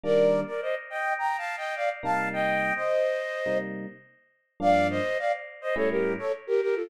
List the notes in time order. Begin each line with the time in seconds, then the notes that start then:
0.04 D#3 G3 A#3 D4 A#4 D5
0.47 A#4 D5
0.61 C5 D#5
0.90 D#5 G5
1.19 G5 A#5
1.38 F5 A5
1.57 D#5 G5
1.76 D5 F5
2.03 C3 G3 A#3 D#4 F5 A5
2.33 D#5 G5
2.76 C5 D#5
3.46 C3 G3 A#3 D#4
4.60 G2 F3 A#3 D4 D5 F5
4.90 C5 D#5
5.19 D5 F5
5.61 C5 D#5
5.76 A2 G3 C#4 E4 A4 C#5
5.90 G4 A#4
6.19 A4 C#5
6.47 G4 A#4
6.61 G4 A#4
6.76 F4 A4